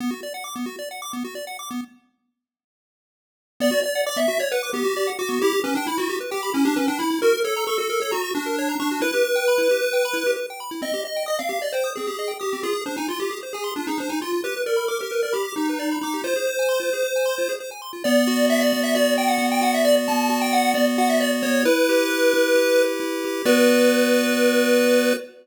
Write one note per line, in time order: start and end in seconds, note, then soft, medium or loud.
0.00 0.11 B3 medium
0.11 0.21 F#4 medium
0.23 0.33 D5 medium
0.34 0.44 F#5 medium
0.44 0.54 D6 medium
0.56 0.66 B3 medium
0.66 0.76 F#4 medium
0.79 0.89 D5 medium
0.91 1.01 F#5 medium
1.02 1.12 D6 medium
1.13 1.23 B3 medium
1.24 1.35 F#4 medium
1.35 1.45 D5 medium
1.47 1.57 F#5 medium
1.59 1.69 D6 medium
1.71 1.81 B3 medium
3.60 3.70 B3 medium
3.60 3.80 D5 medium
3.71 3.81 F#4 medium
3.83 3.93 D5 medium
3.83 4.02 D5 medium
3.95 4.05 F#5 medium
4.06 4.17 D5 medium
4.06 4.17 D6 medium
4.16 4.27 B3 medium
4.16 4.39 E5 medium
4.28 4.38 F#4 medium
4.39 4.51 C#5 medium
4.39 4.49 D5 medium
4.52 4.70 B4 medium
4.52 4.62 F#5 medium
4.63 4.73 D6 medium
4.73 4.83 B3 medium
4.73 5.10 G4 medium
4.84 4.94 F#4 medium
4.97 5.07 D5 medium
5.07 5.17 F#5 medium
5.19 5.40 F#4 medium
5.19 5.29 D6 medium
5.29 5.39 B3 medium
5.42 5.53 E4 medium
5.42 5.60 G4 medium
5.53 5.63 G4 medium
5.64 5.74 C#4 medium
5.64 5.74 B4 medium
5.75 5.86 D4 medium
5.75 5.87 G5 medium
5.87 5.98 E4 medium
5.87 5.98 B5 medium
5.98 6.08 E4 medium
5.98 6.17 F#4 medium
6.09 6.19 G4 medium
6.20 6.31 B4 medium
6.31 6.50 G4 medium
6.31 6.41 G5 medium
6.43 6.53 B5 medium
6.54 6.65 C#4 medium
6.54 6.64 E4 medium
6.65 6.76 D4 medium
6.65 6.75 G4 medium
6.76 6.87 C#4 medium
6.76 6.86 B4 medium
6.88 6.99 D4 medium
6.88 6.98 G5 medium
6.99 7.19 E4 medium
6.99 7.09 B5 medium
7.11 7.21 E4 medium
7.22 7.33 F#4 medium
7.22 7.40 A#4 medium
7.33 7.44 A#4 medium
7.44 7.65 A4 medium
7.44 7.54 C#5 medium
7.56 7.67 A#5 medium
7.67 7.78 A4 medium
7.67 7.77 C#6 medium
7.78 7.88 F#4 medium
7.78 8.00 A4 medium
7.90 8.00 A#4 medium
8.00 8.11 A4 medium
8.00 8.12 C#5 medium
8.11 8.31 F#4 medium
8.11 8.21 A#5 medium
8.24 8.34 C#6 medium
8.35 8.75 D4 medium
8.35 8.45 F#4 medium
8.46 8.56 A#4 medium
8.58 8.69 C#5 medium
8.69 8.80 A#5 medium
8.80 9.00 D4 medium
8.80 8.90 C#6 medium
8.91 9.01 F#4 medium
9.01 9.11 E4 medium
9.01 10.31 B4 loud
9.14 9.24 G4 medium
9.25 9.35 B4 medium
9.36 9.46 G5 medium
9.48 9.58 B5 medium
9.58 9.68 E4 medium
9.71 9.81 G4 medium
9.82 9.92 B4 medium
9.93 10.03 G5 medium
10.05 10.15 B5 medium
10.13 10.24 E4 medium
10.26 10.36 G4 medium
10.36 10.46 B4 medium
10.50 10.60 G5 medium
10.60 10.70 B5 medium
10.71 10.81 E4 medium
10.82 10.92 C4 medium
10.82 11.01 D#5 medium
10.94 11.04 G4 medium
11.05 11.23 D#5 medium
11.05 11.16 D#5 medium
11.16 11.27 G5 medium
11.26 11.39 D#5 medium
11.26 11.36 D#6 medium
11.39 11.49 C4 soft
11.39 11.61 F5 medium
11.49 11.59 G4 medium
11.62 11.72 D5 medium
11.62 11.73 D#5 medium
11.72 11.91 C5 medium
11.72 11.84 G5 medium
11.84 11.94 D#6 soft
11.96 12.07 C4 soft
11.96 12.32 G#4 medium
12.07 12.17 G4 medium
12.19 12.29 D#5 medium
12.28 12.38 G5 medium
12.39 12.62 G4 medium
12.39 12.50 D#6 soft
12.53 12.63 C4 medium
12.63 12.73 F4 medium
12.63 12.81 G#4 medium
12.73 12.83 G#4 medium
12.86 12.96 D4 medium
12.86 12.96 C5 medium
12.97 13.07 D#4 medium
12.97 13.08 G#5 medium
13.08 13.19 F4 medium
13.08 13.20 C6 medium
13.20 13.30 F4 medium
13.20 13.39 G4 medium
13.31 13.41 G#4 medium
13.43 13.53 C5 medium
13.53 13.72 G#4 medium
13.53 13.64 G#5 medium
13.64 13.74 C6 medium
13.76 13.87 D4 medium
13.76 13.86 F4 soft
13.87 13.98 D#4 medium
13.87 13.98 G#4 medium
13.98 14.09 D4 medium
13.98 14.10 C5 medium
14.09 14.20 D#4 medium
14.09 14.19 G#5 soft
14.22 14.41 F4 medium
14.22 14.32 C6 medium
14.33 14.43 F4 medium
14.44 14.55 G4 medium
14.44 14.62 B4 medium
14.56 14.67 B4 medium
14.66 14.86 A#4 medium
14.66 14.76 D5 soft
14.76 14.87 B5 medium
14.88 14.99 A#4 medium
14.88 14.98 D6 medium
15.01 15.11 G4 medium
15.01 15.22 A#4 medium
15.11 15.22 B4 medium
15.23 15.34 A#4 medium
15.23 15.33 D5 soft
15.33 15.52 G4 medium
15.33 15.43 B5 medium
15.45 15.55 D6 medium
15.56 15.97 D#4 medium
15.56 15.67 G4 medium
15.69 15.79 B4 medium
15.79 15.89 D5 medium
15.91 16.02 B5 medium
16.01 16.22 D#4 medium
16.01 16.13 D6 medium
16.14 16.24 G4 medium
16.24 16.34 F4 medium
16.24 17.53 C5 medium
16.36 16.46 G#4 medium
16.47 16.57 C5 medium
16.59 16.69 G#5 medium
16.69 16.79 C6 medium
16.80 16.90 F4 medium
16.93 17.03 G#4 soft
17.03 17.13 C5 medium
17.16 17.26 G#5 medium
17.25 17.36 C6 medium
17.38 17.48 F4 medium
17.49 17.59 G#4 soft
17.60 17.70 C5 medium
17.71 17.81 G#5 soft
17.82 17.92 C6 soft
17.93 18.03 F4 soft
18.04 18.72 B3 medium
18.04 18.46 D5 medium
18.27 18.95 F#4 medium
18.49 19.17 D5 medium
18.49 18.61 E5 medium
18.61 18.81 D5 medium
18.73 19.38 B3 medium
18.83 18.94 E5 medium
18.95 19.61 F#4 medium
18.95 19.14 D5 medium
19.17 19.84 D5 medium
19.17 19.28 G5 medium
19.28 19.47 F#5 medium
19.38 20.08 B3 medium
19.52 19.62 G5 medium
19.61 20.29 F#4 medium
19.61 19.73 F#5 medium
19.74 19.85 E5 medium
19.85 20.54 D5 medium
19.85 19.96 D5 medium
20.08 20.74 B3 medium
20.08 20.39 A5 medium
20.29 20.98 F#4 medium
20.41 20.52 G5 medium
20.53 21.21 D5 medium
20.53 20.72 F#5 medium
20.74 21.42 B3 medium
20.74 20.86 D5 medium
20.98 21.62 F#4 medium
20.98 21.09 F#5 medium
21.09 21.20 E5 medium
21.20 21.31 D5 medium
21.20 21.64 D5 medium
21.43 21.64 B3 medium
21.43 21.63 C#5 medium
21.65 22.33 E4 loud
21.65 22.82 B4 loud
21.89 22.55 G4 medium
22.10 22.77 B4 medium
22.34 22.99 E4 medium
22.55 23.24 G4 medium
22.78 23.42 B4 medium
23.00 23.43 E4 medium
23.25 23.46 G4 medium
23.45 25.13 B3 loud
23.45 25.13 F#4 loud
23.45 25.14 B4 loud
23.45 25.13 D5 loud